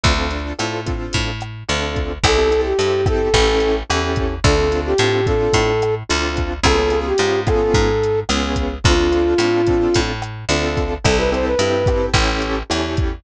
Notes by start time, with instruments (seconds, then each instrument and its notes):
0.03 electric bass (finger) D2, acoustic grand piano C4 D4 F4 A4, kick, closed hi-hat
0.18 acoustic grand piano C4 D4 F4 A4
0.31 acoustic grand piano C4 D4 F4 A4, closed hi-hat
0.59 electric bass (finger) A2, acoustic grand piano C4 D4 F4 A4, cross-stick, closed hi-hat
0.86 acoustic grand piano C4 D4 F4 A4, kick, closed hi-hat
1.13 electric bass (finger) A2, kick, closed hi-hat
1.41 cross-stick, closed hi-hat
1.68 electric bass (finger) D2, acoustic grand piano C4 D4 F4 A4, closed hi-hat
1.96 kick, closed hi-hat
2.24 electric bass (finger) C2, acoustic grand piano C4 E4 G4 A4, flute A4, kick, cross-stick, closed hi-hat
2.38 acoustic grand piano C4 E4 G4 A4
2.51 acoustic grand piano C4 E4 G4 A4, closed hi-hat
2.65 flute G4
2.79 electric bass (finger) G2, acoustic grand piano C4 E4 G4 A4, closed hi-hat
3.06 acoustic grand piano C4 E4 G4 A4, flute A4, kick, cross-stick, closed hi-hat
3.34 electric bass (finger) A1, acoustic grand piano C#4 E4 G4 A4, kick, closed hi-hat
3.60 closed hi-hat
3.90 electric bass (finger) E2, acoustic grand piano C#4 E4 G4 A4, cross-stick, closed hi-hat
4.16 kick, closed hi-hat
4.44 electric bass (finger) D2, acoustic grand piano C4 D4 F4 A4, flute A4, kick, closed hi-hat
4.58 acoustic grand piano C4 D4 F4 A4
4.72 acoustic grand piano C4 D4 F4 A4, closed hi-hat
4.86 flute G4
4.98 electric bass (finger) A2, acoustic grand piano C4 D4 F4 A4, cross-stick, closed hi-hat
5.26 acoustic grand piano C4 D4 F4 A4, flute A4, kick, closed hi-hat
5.53 electric bass (finger) A2, kick, closed hi-hat
5.82 cross-stick, closed hi-hat
6.09 electric bass (finger) D2, acoustic grand piano C4 D4 F4 A4, closed hi-hat
6.37 kick, closed hi-hat
6.63 electric bass (finger) C#2, acoustic grand piano B3 C#4 F4 G#4, flute A4, kick, cross-stick, closed hi-hat
6.78 acoustic grand piano B3 C#4 F4 G#4
6.90 acoustic grand piano B3 C#4 F4 G#4, closed hi-hat
7.06 flute G4
7.18 electric bass (finger) G#2, acoustic grand piano B3 C#4 F4 G#4, closed hi-hat
7.47 acoustic grand piano B3 C#4 F4 G#4, flute A4, kick, cross-stick, closed hi-hat
7.74 electric bass (finger) G#2, kick, closed hi-hat
8.04 closed hi-hat
8.29 electric bass (finger) C#2, acoustic grand piano B3 C#4 F4 G#4, cross-stick, closed hi-hat
8.56 kick, closed hi-hat
8.84 electric bass (finger) D2, acoustic grand piano C4 D4 F4 A4, flute F4, kick, closed hi-hat
8.99 acoustic grand piano C4 D4 F4 A4
9.12 acoustic grand piano C4 D4 F4 A4, closed hi-hat
9.38 electric bass (finger) A2, acoustic grand piano C4 D4 F4 A4, cross-stick, closed hi-hat
9.67 acoustic grand piano C4 D4 F4 A4, kick, closed hi-hat
9.94 electric bass (finger) A2, kick, closed hi-hat
10.22 cross-stick, closed hi-hat
10.49 electric bass (finger) D2, acoustic grand piano C4 D4 F4 A4, closed hi-hat
10.77 kick, closed hi-hat
11.04 electric bass (finger) C2, acoustic grand piano C4 E4 G4 A4, flute A4, kick, cross-stick, closed hi-hat
11.18 acoustic grand piano C4 E4 G4 A4, flute B4
11.32 acoustic grand piano C4 E4 G4 A4, flute C5, closed hi-hat
11.46 flute B4
11.59 electric bass (finger) G2, acoustic grand piano C4 E4 G4 A4, closed hi-hat
11.86 acoustic grand piano C4 E4 G4 A4, kick, cross-stick, closed hi-hat
12.14 electric bass (finger) A1, acoustic grand piano C#4 E4 G4 A4, kick, closed hi-hat
12.42 closed hi-hat
12.70 electric bass (finger) E2, acoustic grand piano C#4 E4 G4 A4, cross-stick, closed hi-hat
12.97 kick, closed hi-hat